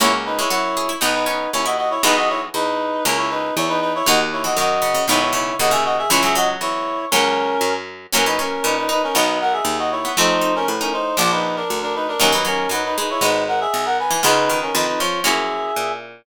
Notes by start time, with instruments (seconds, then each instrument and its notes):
0.00 harpsichord C#2 A#3, acoustic guitar (steel) A#3 C#4 F#4, clarinet E4 C#5
0.26 clarinet D#4 B4
0.39 harpsichord G#3, clarinet E4 C#5
0.50 harpsichord F#2 F#4, clarinet E4 C#5
0.77 harpsichord G#4
0.89 harpsichord E4
1.01 harpsichord B1 D#4, acoustic guitar (steel) B3 D#4 F#4, clarinet D#4 B4
1.14 clarinet D#4 B4
1.26 harpsichord C#4, clarinet D#4 B4
1.53 harpsichord D#2 C#4, clarinet E4 C#5
1.65 harpsichord E4, clarinet F#4 D#5
1.77 clarinet F#4 D#5
1.90 clarinet E4 C#5
2.03 harpsichord B1 E3 G#3, acoustic guitar (steel) B3 E4 G#4, clarinet D#4 B4
2.16 clarinet F#4 D#5
2.29 clarinet E4 C#5
2.54 harpsichord E2, clarinet D#4 B4
3.05 harpsichord C#2, acoustic guitar (steel) A#3 C#4 E4, clarinet C#4 A#4
3.17 clarinet E4 C#5
3.30 clarinet D#4 B4
3.56 harpsichord E2, clarinet E4 C#5
3.68 clarinet D#4 B4
3.81 clarinet D#4 B4
3.95 clarinet E4 C#5
4.06 harpsichord D#2 D#3, acoustic guitar (steel) A#3 D#4 F#4, clarinet F#4 D#5
4.32 clarinet E4 C#5
4.44 harpsichord E3, clarinet F#4 D#5
4.56 harpsichord F#2 D#3, clarinet F#4 D#5
4.82 harpsichord C#3
4.94 harpsichord C#3
5.08 harpsichord B1 D#3, acoustic guitar (steel) G#3 B3 D#4, clarinet E4 C#5
5.21 clarinet E4 C#5
5.33 harpsichord C#3, clarinet E4 C#5
5.59 harpsichord D#2 C#3, clarinet F#4 D#5
5.71 harpsichord C#3, clarinet G#4 E5
5.85 clarinet F#4 D#5
5.98 clarinet G#4 E5
6.10 harpsichord C#2 E3, acoustic guitar (steel) G#3 C#4 E4, clarinet E4 C#5
6.23 harpsichord F#3, clarinet G#4 E5
6.35 harpsichord F#3, clarinet F#4 D#5
6.61 harpsichord E2, clarinet E4 C#5
7.11 harpsichord C#2, acoustic guitar (steel) F#3 A#3 C#4, clarinet C#4 A#4
7.61 harpsichord F#2
8.13 harpsichord F#2 C#4, acoustic guitar (steel) E3 F#3 A#3 C#4, clarinet C#4 A#4
8.26 harpsichord C#4, clarinet D#4 B4
8.39 harpsichord C#4, clarinet C#4 A#4
8.64 harpsichord A#2 C#4, clarinet D#4 B4
8.77 clarinet D#4 B4
8.89 harpsichord D#4, clarinet D#4 B4
9.03 clarinet C#4 A#4
9.14 harpsichord B1, acoustic guitar (steel) D#3 F#3 B3, clarinet D#4 B4
9.41 clarinet A#4 F#5
9.52 clarinet G#4 E5
9.65 harpsichord D#2
9.78 clarinet F#4 D#5
9.91 clarinet E4 C#5
10.05 harpsichord B3
10.17 harpsichord F2 C4, acoustic guitar (steel) F3 A3 C4, clarinet D#4 C5
10.41 harpsichord D#4
10.55 clarinet C#4 A#4
10.68 harpsichord A2, clarinet B4
10.81 clarinet C#4 A#4, harpsichord D#4
10.93 clarinet D#4 C5
11.17 harpsichord A#1, acoustic guitar (steel) F3 A#3 D4, clarinet F4 D5
11.31 clarinet D#4 B4
11.56 clarinet D4 A#4
11.70 harpsichord D2
11.82 clarinet D4 A#4
11.95 clarinet D#4 B4
12.08 clarinet D4 A#4
12.20 harpsichord D#2 F#3, acoustic guitar (steel) F#3 A#3 D#4, clarinet C#4 A#4
12.32 harpsichord F#3, clarinet D#4 B4
12.45 harpsichord F#3, clarinet C#4 A#4
12.69 harpsichord F#2 F#3, clarinet D#4 B4
12.85 clarinet D#4 B4
12.97 harpsichord G#3, clarinet D#4 B4
13.10 clarinet E4 C#5
13.21 harpsichord G#1, acoustic guitar (steel) G#3 B3 D#4, clarinet D#4 B4
13.48 clarinet A#4 F#5
13.60 clarinet G#4 E5
13.74 harpsichord B1
13.85 clarinet A#4 F#5
13.99 clarinet B4 G#5
14.10 harpsichord E3
14.23 harpsichord C#2 C#3, acoustic guitar (steel) G#3 B3 C#4 F4, clarinet D#4 B4
14.50 harpsichord D#3
14.62 clarinet C#4 A#4
14.74 harpsichord F2 D#3, clarinet D#4 B4
14.87 clarinet D#4 B4
14.99 harpsichord F3, clarinet F4 C#5
15.24 harpsichord F#2, acoustic guitar (steel) A#3 C#4 E4 F#4, clarinet G#4 E5
15.76 harpsichord A#2